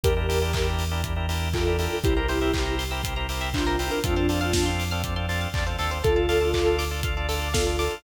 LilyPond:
<<
  \new Staff \with { instrumentName = "Ocarina" } { \time 4/4 \key d \minor \tempo 4 = 120 <g' bes'>4. r4. <f' a'>4 | <e' g'>4. r4. <d' f'>4 | <d' f'>4. r2 r8 | <f' a'>4. r4. <f' a'>4 | }
  \new Staff \with { instrumentName = "Drawbar Organ" } { \time 4/4 \key d \minor <d' e' g' bes'>16 <d' e' g' bes'>16 <d' e' g' bes'>16 <d' e' g' bes'>16 <d' e' g' bes'>8. <d' e' g' bes'>16 <d' e' g' bes'>16 <d' e' g' bes'>16 <d' e' g' bes'>8 <d' e' g' bes'>16 <d' e' g' bes'>16 <d' e' g' bes'>8 | <c' e' g' bes'>16 <c' e' g' bes'>16 <c' e' g' bes'>16 <c' e' g' bes'>16 <c' e' g' bes'>8. <c' e' g' bes'>16 <c' e' g' bes'>16 <c' e' g' bes'>16 <c' e' g' bes'>8 <c' e' g' bes'>16 <c' e' g' bes'>16 <c' e' g' bes'>8 | <c' d' f' a'>16 <c' d' f' a'>16 <c' d' f' a'>16 <c' d' f' a'>16 <c' d' f' a'>8. <c' d' f' a'>16 <c' d' f' a'>16 <c' d' f' a'>16 <c' d' f' a'>8 <c' d' f' a'>16 <c' d' f' a'>16 <c' d' f' a'>8 | <d' f' a'>16 <d' f' a'>16 <d' f' a'>16 <d' f' a'>16 <d' f' a'>8. <d' f' a'>16 <d' f' a'>16 <d' f' a'>16 <d' f' a'>8 <d' f' a'>16 <d' f' a'>16 <d' f' a'>8 | }
  \new Staff \with { instrumentName = "Pizzicato Strings" } { \time 4/4 \key d \minor r1 | g'16 bes'16 c''16 e''16 g''16 bes''16 c'''16 e'''16 c'''16 bes''16 g''16 e''16 c''16 bes'16 g'16 bes'16 | a'16 c''16 d''16 f''16 a''16 c'''16 d'''16 f'''16 d'''16 c'''16 a''16 f''16 d''16 c''16 a'16 c''16 | a'16 d''16 f''16 a''16 d'''16 f'''16 d'''16 a''16 f''16 d''16 a'16 d''16 f''16 a''16 d'''16 f'''16 | }
  \new Staff \with { instrumentName = "Synth Bass 1" } { \clef bass \time 4/4 \key d \minor e,1 | c,1 | f,2. e,8 ees,8 | d,1 | }
  \new DrumStaff \with { instrumentName = "Drums" } \drummode { \time 4/4 <hh bd>8 hho8 <hc bd>8 hho8 <hh bd>8 hho8 <hc bd>8 hho8 | <hh bd>8 hho8 <hc bd>8 hho8 <hh bd>8 hho8 <hc bd>8 hho8 | <hh bd>8 hho8 <bd sn>8 hho8 <hh bd>8 hho8 <hc bd>8 hho8 | <hh bd>8 hho8 <hc bd>8 hho8 <hh bd>8 hho8 <bd sn>8 hho8 | }
>>